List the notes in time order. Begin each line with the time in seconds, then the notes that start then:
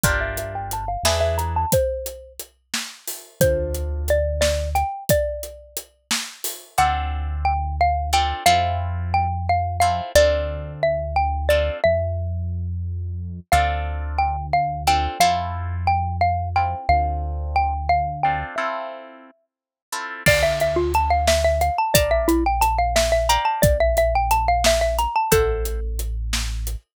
0.04 G1 D4 F4 G4 A#4 D5, kick, closed hi-hat
0.21 E5
0.37 E5, closed hi-hat
0.55 G5
0.71 A5, closed hi-hat
0.88 F5
1.03 E2 D4 E4 G#4 B4 E5, snare
1.21 E5
1.38 A#5, closed hi-hat
1.56 A5
1.72 C5, kick, closed hi-hat
2.06 closed hi-hat
2.39 closed hi-hat
2.74 snare
3.08 open hi-hat
3.40 D2 D4 F4 A4 C5, kick, closed hi-hat
3.74 closed hi-hat
4.08 D5, closed hi-hat
4.41 D5, snare
4.75 G5, closed hi-hat
5.09 D5, kick, closed hi-hat
5.43 closed hi-hat
5.77 closed hi-hat
6.11 snare
6.44 open hi-hat
6.78 D2 C4 D4 F4 A4 F#5
7.45 G5
7.81 F5
8.13 C4 D4 F4 A4 G5
8.46 F2 C4 E4 F4 A4 F5
9.14 G5
9.49 F5
9.80 C4 E4 F4 A4 F5
10.15 D2 C4 D4 F4 A4 D5
10.83 E5
11.16 G5
11.49 C4 D4 F4 A4 D5
11.84 F2 E5
13.52 D2 C4 D4 F4 A4 F5
14.18 G5
14.53 F5
14.87 C4 D4 F4 A4 G5
15.20 F2 C4 E4 F4 A4 F5
15.87 G5
16.21 F5
16.56 C4 E4 F4 A4 G5
16.89 D2 C4 D4 F4 A4 F5
17.56 G5
17.89 F5
18.23 C4 D4 F4 A4 G5
18.56 C4 E4 F4 A4 E5
19.92 C4 E4 F4 A4
20.26 D2 D5 F5 A5 C6, kick, crash
20.43 E5
20.60 E5, closed hi-hat
20.76 F4
20.94 A5, closed hi-hat
21.10 F5
21.27 E5, snare
21.45 E5
21.61 F5, closed hi-hat
21.78 A5
21.94 A#1 D5 F5 A5 A#5, kick, closed hi-hat
22.11 E5
22.28 E4, closed hi-hat
22.46 G5
22.61 A5, closed hi-hat
22.79 F5
22.96 E5, snare
23.12 E5
23.29 D5 F5 G5 A#5, closed hi-hat
23.45 A5
23.62 A#1 D5, kick, closed hi-hat
23.80 E5
23.97 E5, closed hi-hat
24.15 G5
24.31 A5, closed hi-hat
24.48 F5
24.64 E5, snare
24.81 E5
24.99 A#5, closed hi-hat
25.16 A5
25.31 A1 A4 C5 E5 F#5 A5, kick, closed hi-hat
25.65 closed hi-hat
25.99 closed hi-hat
26.33 snare
26.67 closed hi-hat